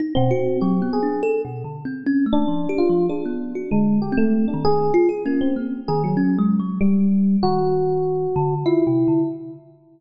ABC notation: X:1
M:3/4
L:1/16
Q:1/4=97
K:none
V:1 name="Electric Piano 1"
z C3 G2 _A2 z4 | z3 D3 F2 D4 | _A,2 G =A,2 D _A2 z2 _B, C | z2 _A _G,5 =G,4 |
_G8 E4 |]
V:2 name="Kalimba"
_E B,, _G2 (3_G,2 B,2 D2 (3A2 B,,2 D,2 | (3C2 _D2 A,2 (3F,2 G2 F,2 _A B,2 _G | (3D,4 C4 _E,4 F _A _D2 | _B,2 _E,2 (3_D2 _A,2 _G,2 z4 |
_E,6 D,2 (3F2 C,2 D,2 |]